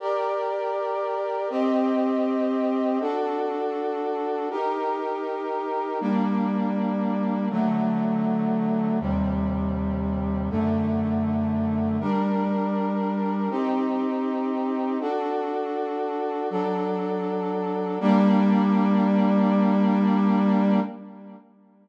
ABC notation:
X:1
M:4/4
L:1/8
Q:1/4=80
K:Gm
V:1 name="Brass Section"
[GBd]4 [CGe]4 | [D^FA]4 [EGB]4 | [G,B,D]4 [D,^F,A,]4 | [E,,C,G,]4 [^F,,D,A,]4 |
[G,DB]4 [CEG]4 | [D^FA]4 [^F,DA]4 | [G,B,D]8 |]